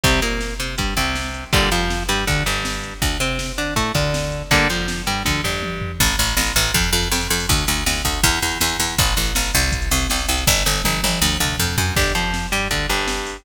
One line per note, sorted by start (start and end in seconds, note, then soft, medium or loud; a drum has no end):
0.04 0.20 C2 medium
0.04 0.20 C3 medium
0.04 0.20 G3 medium
0.04 kick loud
0.04 closed hi-hat medium
0.22 0.54 A#2 medium
0.22 0.54 A#3 medium
0.22 closed hi-hat medium
0.41 snare medium
0.60 0.76 C3 medium
0.60 0.75 C4 medium
0.60 closed hi-hat medium
0.78 0.94 G2 medium
0.78 0.94 G3 medium
0.78 kick medium
0.78 closed hi-hat medium
0.97 1.44 C2 medium
0.97 1.45 C3 medium
0.97 kick medium
0.97 closed hi-hat medium
1.16 snare medium
1.34 closed hi-hat medium
1.53 1.69 G1 medium
1.53 1.69 A#2 medium
1.53 1.69 D3 medium
1.53 1.69 G3 medium
1.53 kick loud
1.53 closed hi-hat medium
1.71 2.03 F2 medium
1.71 2.03 F3 medium
1.71 closed hi-hat medium
1.90 snare medium
2.09 2.24 G2 medium
2.09 2.25 G3 medium
2.09 closed hi-hat medium
2.27 2.43 D2 medium
2.27 2.43 D3 medium
2.27 kick medium
2.27 closed hi-hat soft
2.46 2.94 G1 medium
2.46 2.94 G2 medium
2.46 closed hi-hat medium
2.65 snare loud
2.84 closed hi-hat medium
3.02 3.18 D2 medium
3.02 kick medium
3.02 closed hi-hat medium
3.20 3.52 C3 medium
3.20 3.52 C4 medium
3.20 closed hi-hat medium
3.39 snare loud
3.58 3.74 D3 medium
3.58 3.74 D4 medium
3.58 closed hi-hat medium
3.76 3.92 A2 medium
3.76 3.92 A3 medium
3.76 kick medium
3.76 closed hi-hat loud
3.94 4.42 D2 medium
3.94 4.43 D3 medium
3.94 kick medium
3.94 closed hi-hat medium
4.14 snare loud
4.32 closed hi-hat medium
4.51 4.67 G1 medium
4.51 4.68 D3 medium
4.51 4.68 G3 medium
4.51 4.68 A#3 medium
4.51 kick medium
4.51 closed hi-hat medium
4.69 5.01 F2 medium
4.69 5.02 F3 medium
4.69 closed hi-hat medium
4.88 snare loud
5.07 5.23 G2 medium
5.07 5.23 G3 medium
5.07 closed hi-hat medium
5.25 5.42 D2 medium
5.25 5.41 D3 medium
5.25 kick medium
5.25 high tom medium
5.44 5.92 G1 medium
5.44 5.92 G2 medium
5.44 floor tom medium
5.63 high tom medium
5.82 floor tom loud
6.00 6.16 A1 loud
6.00 kick medium
6.00 crash loud
6.10 closed hi-hat medium
6.19 6.35 A1 loud
6.19 closed hi-hat medium
6.28 closed hi-hat medium
6.37 6.53 A1 loud
6.37 snare loud
6.47 closed hi-hat medium
6.56 6.72 A1 loud
6.56 closed hi-hat medium
6.65 closed hi-hat medium
6.74 6.90 F2 loud
6.74 kick medium
6.74 closed hi-hat medium
6.84 closed hi-hat medium
6.93 7.08 F2 loud
6.93 closed hi-hat medium
7.03 closed hi-hat medium
7.12 7.27 F2 loud
7.12 snare loud
7.21 closed hi-hat medium
7.30 7.46 F2 loud
7.30 closed hi-hat medium
7.40 open hi-hat medium
7.49 7.65 D2 loud
7.49 kick loud
7.49 closed hi-hat medium
7.58 closed hi-hat medium
7.67 7.84 D2 loud
7.67 closed hi-hat medium
7.77 closed hi-hat medium
7.86 8.02 D2 medium
7.86 snare loud
7.96 closed hi-hat medium
8.05 8.21 D2 medium
8.05 kick medium
8.05 closed hi-hat medium
8.14 closed hi-hat medium
8.23 8.39 E2 loud
8.23 kick loud
8.23 closed hi-hat medium
8.33 closed hi-hat medium
8.42 8.58 E2 medium
8.42 closed hi-hat medium
8.52 closed hi-hat medium
8.61 8.77 E2 loud
8.61 snare loud
8.70 closed hi-hat medium
8.80 8.95 E2 loud
8.80 closed hi-hat medium
8.89 closed hi-hat medium
8.98 9.14 A1 loud
8.98 kick loud
8.98 closed hi-hat loud
9.07 closed hi-hat medium
9.16 9.33 A1 medium
9.16 closed hi-hat medium
9.26 closed hi-hat medium
9.35 9.52 A1 medium
9.35 snare loud
9.45 closed hi-hat medium
9.54 9.89 C2 loud
9.54 closed hi-hat medium
9.63 closed hi-hat medium
9.72 kick medium
9.72 closed hi-hat loud
9.82 closed hi-hat medium
9.91 10.07 C2 loud
9.91 closed hi-hat medium
10.01 closed hi-hat medium
10.10 10.26 C2 medium
10.10 snare loud
10.19 closed hi-hat medium
10.28 10.44 C2 loud
10.28 closed hi-hat medium
10.38 closed hi-hat medium
10.47 10.63 G1 loud
10.47 kick medium
10.47 snare medium
10.65 10.82 G1 loud
10.65 snare medium
10.84 11.01 G1 medium
10.84 high tom medium
11.03 11.20 G1 loud
11.03 high tom medium
11.22 11.37 D2 loud
11.40 11.56 D2 loud
11.40 mid tom medium
11.59 11.76 F2 loud
11.59 floor tom medium
11.78 11.94 F#2 medium
11.78 floor tom loud
11.96 12.12 G1 medium
11.96 12.13 D4 medium
11.96 12.13 G4 medium
11.96 kick loud
11.96 crash medium
12.15 12.47 F2 medium
12.15 12.47 F3 medium
12.15 closed hi-hat medium
12.34 snare medium
12.52 12.68 G2 medium
12.52 12.68 G3 medium
12.52 closed hi-hat medium
12.71 12.86 D2 medium
12.71 12.86 D3 medium
12.71 kick medium
12.71 closed hi-hat medium
12.89 13.37 G1 medium
12.89 13.37 G2 medium
12.89 closed hi-hat medium
13.08 snare loud
13.27 open hi-hat medium